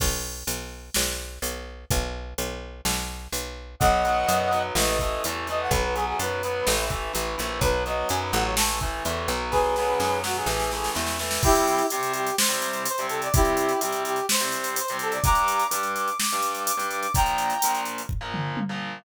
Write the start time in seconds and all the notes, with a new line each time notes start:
0.00 B1, kick, crash
0.47 B1, closed hi-hat
0.94 B1, snare
1.42 B1, closed hi-hat
1.90 B1, kick, closed hi-hat
2.38 B1, closed hi-hat
2.85 B1, snare
3.32 B1, closed hi-hat
3.80 B1 F#3 B3 D#5 F#5, kick, closed hi-hat
4.05 F#3 B3, closed hi-hat
4.27 F#2 F#3 B3, closed hi-hat
4.51 F#3 B3, closed hi-hat
4.75 A1 E3 A3 D#5, snare
4.87 D#5
4.99 E3 A3, kick, closed hi-hat
5.24 E2 E3 A3, closed hi-hat
5.47 E3 A3 D#5, closed hi-hat
5.61 F#5
5.71 B1 F#3 B3 B4, kick, closed hi-hat
5.83 B4
5.94 F#3 B3 G#4, closed hi-hat
6.07 G#4
6.19 F#2 F#3 B3 B4, closed hi-hat
6.43 F#3 B3, closed hi-hat
6.67 A1 E3 A3, snare
6.90 E3 A3, kick, closed hi-hat
7.13 A1 E3 A3, closed hi-hat
7.38 A#1 E3 A3, closed hi-hat
7.61 B1 F#3 B3 B4, kick, closed hi-hat
7.86 F#3 B3 D#5, closed hi-hat
8.08 F#2 F#3 B3 G#5, closed hi-hat
8.22 B5
8.32 A1 F#3 B3 F#5, closed hi-hat
8.44 C#5
8.57 E3 A3 A5, snare
8.80 E3 A3, kick, closed hi-hat
9.05 E2 E3 A3, closed hi-hat
9.28 B1 F#3 B3, closed hi-hat
9.51 G#4 B4, kick, snare
9.76 F#3 B3, snare
10.00 F#2 F#3 B3, snare
10.23 F#3 B3 F#4, snare
10.36 G#4
10.46 A1 E3 A3, snare
10.60 snare
10.71 E3 A3, snare
10.84 snare
10.95 E2 E3 A3, snare
11.07 snare
11.19 E3 A3, snare
11.31 snare
11.43 C3 G3 C4 E4 G4, kick, crash
11.55 closed hi-hat
11.67 closed hi-hat
11.78 closed hi-hat
11.90 C3 G3 C4 G4, closed hi-hat
12.03 closed hi-hat
12.13 G4, closed hi-hat
12.26 closed hi-hat
12.37 C5, snare
12.49 C3 G3 C4, closed hi-hat
12.62 closed hi-hat
12.73 closed hi-hat
12.86 C5, closed hi-hat
12.98 C3 G3 C4, closed hi-hat
13.09 A4, closed hi-hat
13.22 D5, closed hi-hat
13.34 C3 G3 C4 E4 G4, kick, closed hi-hat
13.45 closed hi-hat
13.57 closed hi-hat
13.69 closed hi-hat
13.81 C3 G3 C4 G4, closed hi-hat
13.92 closed hi-hat
14.05 G4, closed hi-hat
14.16 closed hi-hat
14.29 C5, snare
14.40 C3 G3 C4, closed hi-hat
14.52 closed hi-hat
14.64 closed hi-hat
14.76 C5, closed hi-hat
14.88 C3 G3 C4, closed hi-hat
14.99 A4, closed hi-hat
15.12 D5, closed hi-hat
15.24 G2 G3 D4 A#5 D6, kick, closed hi-hat
15.35 closed hi-hat
15.48 closed hi-hat
15.59 closed hi-hat
15.70 G2 G3 D4 D6, closed hi-hat
15.83 closed hi-hat
15.96 D6, closed hi-hat
16.08 closed hi-hat
16.18 D6, snare
16.30 G2 G3, closed hi-hat
16.35 D4
16.42 closed hi-hat
16.55 closed hi-hat
16.66 D6, closed hi-hat
16.77 G2 G3 D4, closed hi-hat
16.89 D6, closed hi-hat
17.01 D6, closed hi-hat
17.14 A#2 F3 A#3 G5 A#5, kick, closed hi-hat
17.26 closed hi-hat
17.38 closed hi-hat
17.50 closed hi-hat
17.62 A#2 F3 A#3, closed hi-hat
17.75 closed hi-hat
17.85 closed hi-hat
17.98 closed hi-hat
18.09 kick, floor tom
18.21 A#2 F3 A#3
18.34 mid tom
18.57 high tom
18.69 A#2 F3 A#3